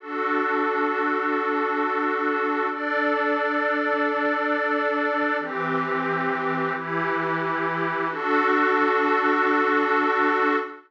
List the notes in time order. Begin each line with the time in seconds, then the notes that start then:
0.00 D4 F#4 A4
2.70 D4 A4 D5
5.39 E3 C4 G4
6.74 E3 E4 G4
8.09 D4 F#4 A4